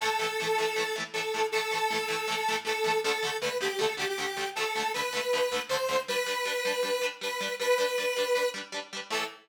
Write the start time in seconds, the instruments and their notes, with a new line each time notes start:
0.01 overdriven guitar A2 E3, lead 1 (square) A4
0.05 overdriven guitar A3
0.19 overdriven guitar A2 E3
0.23 overdriven guitar A3
0.40 overdriven guitar A2 E3 A3
0.58 overdriven guitar A2 E3 A3
0.76 overdriven guitar A2 E3
0.80 overdriven guitar A3
0.96 overdriven guitar A2 E3 A3
1.14 overdriven guitar A2 E3, lead 1 (square) A4
1.18 overdriven guitar A3
1.34 overdriven guitar A2 E3 A3
1.52 overdriven guitar A2 E3, lead 1 (square) A4
1.57 overdriven guitar A3
1.71 overdriven guitar A2 E3 A3
1.91 overdriven guitar A2 E3 A3
2.08 overdriven guitar A2 E3 A3
2.28 overdriven guitar A2 E3
2.32 overdriven guitar A3
2.48 overdriven guitar A2 E3 A3
2.65 overdriven guitar A2 E3 A3, lead 1 (square) A4
2.84 overdriven guitar A2 E3 A3
3.04 overdriven guitar D2 D3, lead 1 (square) A4
3.08 overdriven guitar A3
3.23 overdriven guitar D2 D3 A3
3.41 overdriven guitar D2 D3, lead 1 (square) B4
3.46 overdriven guitar A3
3.61 overdriven guitar D2 D3 A3, lead 1 (square) G4
3.79 overdriven guitar D2 D3 A3, lead 1 (square) A4
3.97 overdriven guitar D2 D3, lead 1 (square) G4
4.01 overdriven guitar A3
4.09 lead 1 (square) G4
4.18 overdriven guitar D2 D3 A3
4.37 overdriven guitar D2 D3 A3
4.55 overdriven guitar D2 D3, lead 1 (square) A4
4.60 overdriven guitar A3
4.75 overdriven guitar D2 D3 A3
4.94 overdriven guitar D2 D3, lead 1 (square) B4
4.98 overdriven guitar A3
5.13 overdriven guitar D2 D3 A3
5.33 overdriven guitar D2 D3 A3
5.52 overdriven guitar D2 D3 A3
5.69 overdriven guitar D2 D3, lead 1 (square) C5
5.73 overdriven guitar A3
5.89 overdriven guitar D2 D3 A3
6.08 overdriven guitar G3 D4, lead 1 (square) B4
6.12 overdriven guitar B4
6.26 overdriven guitar G3 D4 B4
6.45 overdriven guitar G3 D4
6.49 overdriven guitar B4
6.65 overdriven guitar G3 D4
6.69 overdriven guitar B4
6.83 overdriven guitar G3 D4
6.87 overdriven guitar B4
7.02 overdriven guitar G3 D4 B4
7.21 overdriven guitar G3 D4 B4, lead 1 (square) B4
7.41 overdriven guitar G3 D4 B4
7.60 overdriven guitar G3 D4 B4, lead 1 (square) B4
7.78 overdriven guitar G3 D4 B4
7.98 overdriven guitar G3 D4
8.02 overdriven guitar B4
8.16 overdriven guitar G3 D4
8.20 overdriven guitar B4
8.35 overdriven guitar G3 D4 B4
8.54 overdriven guitar G3 D4
8.58 overdriven guitar B4
8.72 overdriven guitar G3 D4 B4
8.93 overdriven guitar G3 D4 B4
9.10 overdriven guitar A2 E3 A3, lead 1 (square) A4